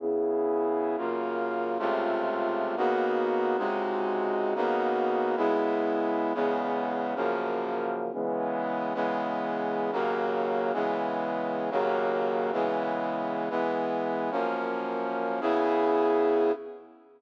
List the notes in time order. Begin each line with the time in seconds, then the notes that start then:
0.00 C#3 B3 E4 G#4
0.97 F#2 C#3 A#3 F4
1.79 C#2 C3 A3 F4
2.77 C#3 A#3 B3 D#4 F#4
3.58 C#2 C3 G#3 D#4 F#4
4.55 C#3 A#3 B3 D#4 F#4
5.36 C#3 G#3 B3 E4
6.34 E2 C#3 G#3 B3
7.15 F#2 C#3 F3 A#3
8.13 C#3 E3 G#3 B3
8.94 C#3 E3 G#3 B3
9.92 D#2 C#3 F#3 A#3
10.73 C#3 E3 G#3 B3
11.71 D#2 C#3 F#3 A#3
12.52 C#3 E3 G#3 B3
13.50 E3 G#3 B3
14.31 F#2 F3 A#3 C#4
15.41 C#3 B3 E4 G#4